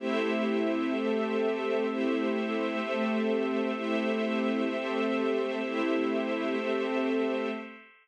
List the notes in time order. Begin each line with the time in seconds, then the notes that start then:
0.00 A3 C4 E4 G4 C5 E5
0.94 A3 C4 G4 A4
1.87 A3 C4 E4 G4 C5 E5
2.81 A3 C4 G4 A4
3.75 A3 C4 E4 G4 C5 E5
4.69 A3 C4 G4 A4
5.62 A3 C4 E4 G4 C5 E5
6.56 A3 C4 G4 A4